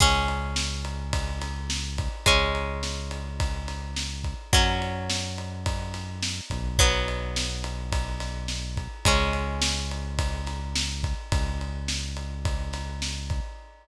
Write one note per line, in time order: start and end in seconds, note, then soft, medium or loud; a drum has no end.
0.00 2.08 C#2 loud
0.00 2.22 G#3 medium
0.00 2.22 C#4 medium
0.00 kick medium
0.00 crash medium
0.28 ride medium
0.56 snare medium
0.85 ride medium
1.13 kick medium
1.13 ride medium
1.41 snare soft
1.41 ride medium
1.70 snare medium
1.98 kick medium
1.98 ride medium
2.26 4.35 C#2 medium
2.26 4.48 G#3 medium
2.26 4.48 C#4 medium
2.26 kick medium
2.26 ride medium
2.55 ride medium
2.83 snare medium
3.11 ride medium
3.40 kick medium
3.40 ride medium
3.68 snare soft
3.68 ride medium
3.96 snare medium
4.24 kick medium
4.24 ride medium
4.52 6.41 F#2 medium
4.52 6.75 F#3 medium
4.52 6.75 C#4 medium
4.52 kick loud
4.52 ride medium
4.82 ride medium
5.10 snare medium
5.38 ride medium
5.66 kick medium
5.66 ride medium
5.94 snare soft
5.94 ride medium
6.23 snare medium
6.50 8.88 B1 loud
6.50 kick medium
6.50 ride medium
6.79 9.01 F#3 medium
6.79 9.01 B3 medium
6.79 kick medium
6.79 ride medium
7.08 ride medium
7.36 snare medium
7.64 ride medium
7.92 kick medium
7.92 ride medium
8.20 snare soft
8.20 ride medium
8.48 snare medium
8.77 kick medium
8.77 ride medium
9.05 11.14 C#2 loud
9.05 11.28 G#3 medium
9.05 11.28 C#4 medium
9.05 kick medium
9.05 ride loud
9.33 ride medium
9.62 snare loud
9.91 ride medium
10.19 kick medium
10.19 ride medium
10.46 snare soft
10.46 ride medium
10.75 snare loud
11.04 kick medium
11.04 ride medium
11.32 13.40 C#2 medium
11.32 kick medium
11.32 ride medium
11.61 ride medium
11.88 snare medium
12.17 ride medium
12.45 kick medium
12.45 ride medium
12.73 snare soft
12.73 ride medium
13.02 snare medium
13.30 kick medium
13.30 ride medium